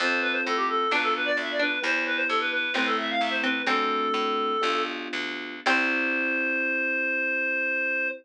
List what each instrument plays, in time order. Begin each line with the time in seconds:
0.00 harpsichord F2, electric piano 1 C4 F4 A4, clarinet C5
0.22 clarinet B4
0.32 clarinet C5
0.46 harpsichord A2, clarinet A4
0.56 clarinet G4
0.69 clarinet A4
0.91 harpsichord B1 D4, electric piano 1 B3 D4 F4, clarinet B4
1.02 clarinet A4
1.16 clarinet B4
1.25 clarinet D5
1.37 harpsichord D2, clarinet E5
1.51 clarinet D5
1.59 harpsichord D4, clarinet B4
1.83 harpsichord E2, electric piano 1 B3 E4 G4, clarinet C5
2.06 clarinet B4
2.16 clarinet C5
2.28 harpsichord G2, clarinet A4
2.40 clarinet B4
2.52 clarinet B4
2.74 harpsichord A1 C4, electric piano 1 A3 C4 E4, clarinet B4
2.86 clarinet A4
2.98 clarinet E5
3.10 clarinet F5
3.21 harpsichord C2, clarinet E5
3.30 clarinet C5
3.43 harpsichord C4, clarinet B4
3.67 harpsichord F#2 C4, electric piano 1 A3 C4 D4 F#4, clarinet A4
4.14 harpsichord A2
4.61 harpsichord B1, electric piano 1 B3 D4 F4 G4
5.13 harpsichord D2
5.66 harpsichord C2 C4, electric piano 1 C4 E4 G4, clarinet C5